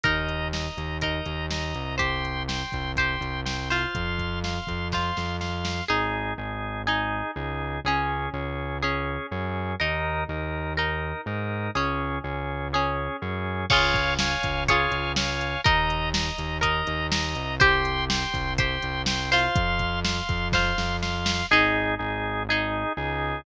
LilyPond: <<
  \new Staff \with { instrumentName = "Acoustic Guitar (steel)" } { \time 4/4 \key aes \major \tempo 4 = 123 <ees' bes'>2 <ees' bes'>2 | <g' c''>2 <g' c''>4. <f' c''>8~ | <f' c''>2 <f' c''>2 | <ees' aes'>2 <ees' aes'>2 |
<des' aes'>2 <des' aes'>2 | <ees' bes'>2 <ees' bes'>2 | <des' aes'>2 <des' aes'>2 | <f' aes' des''>2 <f' aes' des''>2 |
<ees' bes'>2 <ees' bes'>2 | <g' c''>2 <g' c''>4. <f' c''>8~ | <f' c''>2 <f' c''>2 | <ees' aes'>2 <ees' aes'>2 | }
  \new Staff \with { instrumentName = "Drawbar Organ" } { \time 4/4 \key aes \major <ees'' bes''>4 <ees'' bes''>4 <ees'' bes''>4 <ees'' bes''>4 | <g'' c'''>4 <g'' c'''>4 <g'' c'''>4 <g'' c'''>8 <f'' c'''>8~ | <f'' c'''>4 <f'' c'''>4 <f'' c'''>4 <f'' c'''>4 | <ees' aes'>4 <ees' aes'>4 <ees' aes'>4 <ees' aes'>4 |
<des' aes'>4 <des' aes'>4 <des' aes'>4 <des' aes'>4 | <ees' bes'>4 <ees' bes'>4 <ees' bes'>4 <ees' bes'>4 | <des' aes'>4 <des' aes'>4 <des' aes'>4 <des' aes'>4 | <des'' f'' aes''>4 <des'' f'' aes''>4 <des'' f'' aes''>4 <des'' f'' aes''>4 |
<ees'' bes''>4 <ees'' bes''>4 <ees'' bes''>4 <ees'' bes''>4 | <g'' c'''>4 <g'' c'''>4 <g'' c'''>4 <g'' c'''>8 <f'' c'''>8~ | <f'' c'''>4 <f'' c'''>4 <f'' c'''>4 <f'' c'''>4 | <ees' aes'>4 <ees' aes'>4 <ees' aes'>4 <ees' aes'>4 | }
  \new Staff \with { instrumentName = "Synth Bass 1" } { \clef bass \time 4/4 \key aes \major ees,4. ees,4 ees,4 c,8~ | c,4. c,4 c,4. | f,4. f,4 f,4. | aes,,4 aes,,2 des,4 |
des,4 des,2 ges,4 | ees,4 ees,2 aes,4 | des,4 des,2 ges,4 | des,4. des,4 des,4. |
ees,4. ees,4 ees,4 c,8~ | c,4. c,4 c,4. | f,4. f,4 f,4. | aes,,4 aes,,2 des,4 | }
  \new DrumStaff \with { instrumentName = "Drums" } \drummode { \time 4/4 <hh bd>8 hh8 sn8 hh8 <hh bd>8 hh8 sn8 hh8 | <hh bd>8 hh8 sn8 <hh bd>8 <hh bd>8 hh8 sn8 hho8 | <hh bd>8 <hh bd>8 sn8 <hh bd>8 <bd sn>8 sn8 sn8 sn8 | r4 r4 r4 r4 |
r4 r4 r4 r4 | r4 r4 r4 r4 | r4 r4 r4 r4 | <cymc bd>8 <hh bd>8 sn8 <hh bd>8 <hh bd>8 hh8 sn8 hh8 |
<hh bd>8 hh8 sn8 hh8 <hh bd>8 hh8 sn8 hh8 | <hh bd>8 hh8 sn8 <hh bd>8 <hh bd>8 hh8 sn8 hho8 | <hh bd>8 <hh bd>8 sn8 <hh bd>8 <bd sn>8 sn8 sn8 sn8 | r4 r4 r4 r4 | }
>>